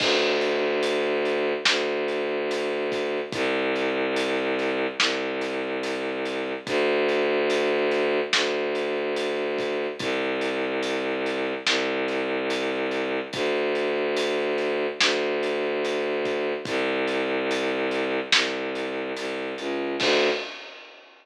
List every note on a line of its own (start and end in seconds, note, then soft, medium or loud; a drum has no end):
0.00 1.53 D2 loud
0.00 kick loud
0.00 crash loud
0.41 closed hi-hat medium
0.83 closed hi-hat loud
1.25 closed hi-hat medium
1.65 3.20 D2 medium
1.65 snare loud
2.08 closed hi-hat medium
2.51 closed hi-hat loud
2.92 kick medium
2.92 closed hi-hat medium
3.32 4.87 C2 loud
3.32 kick loud
3.32 closed hi-hat loud
3.76 closed hi-hat medium
4.16 closed hi-hat loud
4.59 closed hi-hat medium
5.00 6.53 C2 medium
5.00 snare loud
5.41 closed hi-hat medium
5.83 closed hi-hat loud
6.26 closed hi-hat medium
6.67 8.20 D2 loud
6.67 kick loud
6.67 closed hi-hat loud
7.09 closed hi-hat medium
7.50 closed hi-hat loud
7.91 closed hi-hat medium
8.33 9.87 D2 medium
8.33 snare loud
8.75 closed hi-hat medium
9.16 closed hi-hat loud
9.59 kick medium
9.59 closed hi-hat medium
9.99 11.53 C2 loud
9.99 kick loud
9.99 closed hi-hat loud
10.41 closed hi-hat medium
10.83 closed hi-hat loud
11.26 closed hi-hat medium
11.66 13.20 C2 loud
11.66 snare loud
12.08 closed hi-hat medium
12.50 closed hi-hat loud
12.91 closed hi-hat medium
13.33 14.87 D2 medium
13.33 kick loud
13.33 closed hi-hat loud
13.75 closed hi-hat medium
14.16 closed hi-hat loud
14.58 closed hi-hat medium
15.00 16.53 D2 medium
15.00 snare loud
15.43 closed hi-hat medium
15.85 closed hi-hat loud
16.25 kick medium
16.25 closed hi-hat medium
16.65 18.20 C2 loud
16.65 kick loud
16.65 closed hi-hat loud
17.07 closed hi-hat medium
17.51 closed hi-hat loud
17.91 closed hi-hat medium
18.32 19.12 C2 medium
18.32 snare loud
18.75 closed hi-hat medium
19.16 19.54 C2 medium
19.16 closed hi-hat loud
19.58 19.96 C#2 medium
19.58 closed hi-hat medium
20.00 20.29 D2 loud
20.00 kick loud
20.00 crash loud